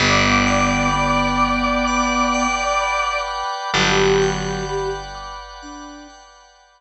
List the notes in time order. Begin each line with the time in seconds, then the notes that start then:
0.00 G1 B3 B4 D5 F#5 G5
0.47 G5
0.93 B3 B5
1.41 D6
1.88 F#5
2.34 G5
2.81 B5
3.28 D6
3.73 G1 F#3 G4 B4 D5 F#5 G5
4.22 G5
4.69 B5
5.15 D6
5.62 D4 F#5
6.10 G5
6.56 B5